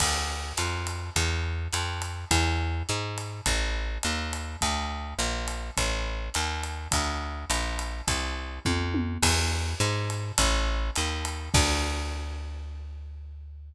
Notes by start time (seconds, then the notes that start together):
0.00 D2, kick, crash, ride
0.57 F2, hi-hat pedal, ride
0.87 ride
1.16 E2, kick, ride
1.72 F2, hi-hat pedal, ride
2.02 ride
2.31 E2, kick, ride
2.89 G#2, hi-hat pedal
3.18 ride
3.46 A1, kick, ride
4.03 D#2, hi-hat pedal, ride
4.33 ride
4.61 D2, kick, ride
5.19 A#1, hi-hat pedal, ride
5.48 ride
5.77 A1, kick, ride
6.34 D#2, hi-hat pedal, ride
6.63 ride
6.91 D2, kick, ride
7.50 A#1, hi-hat pedal, ride
7.79 ride
8.08 C2, kick, ride
8.65 F2, kick, high tom
8.94 high tom
9.22 E2, kick, crash, ride
9.80 G#2, hi-hat pedal, ride
10.10 ride
10.38 A1, kick, ride
10.95 D#2, hi-hat pedal, ride
11.25 ride
11.54 D2, kick, crash